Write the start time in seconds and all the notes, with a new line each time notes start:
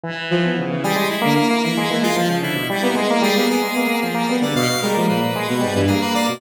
0.04 E3
0.31 F3
0.44 B3
0.59 C#3
0.70 E3
0.84 G3 G#4
0.96 G#3
1.10 E4
1.22 D3 A#3
1.35 A#3
1.50 A#3
1.63 E3 A#3 E4
1.77 G#3
1.90 E3 A#3
2.03 G#3 F4
2.16 F3 F4
2.29 C#3
2.42 D3 E4
2.55 B2
2.70 G3 E4
2.83 A#3 B3
2.95 G#3
3.10 A#3
3.22 G3 G#4
3.36 A#3 B3
3.49 A#3 B3 G#4
3.62 G#3
3.76 A#3 B3
3.87 A#3
4.02 F3 G#4
4.15 A#3
4.29 G3 B3
4.42 D3 D5
4.56 B2 F5
4.70 B2
4.82 G3 G#3 A#4
4.94 F3 A#3
5.08 A#2 A#3 B4
5.21 A#3
5.36 G#3
5.48 B2
5.61 G#2 G3
5.75 G2 E3
5.87 A#3 G#4
6.01 A#3 B4
6.14 A#3 D5
6.27 B2 A#3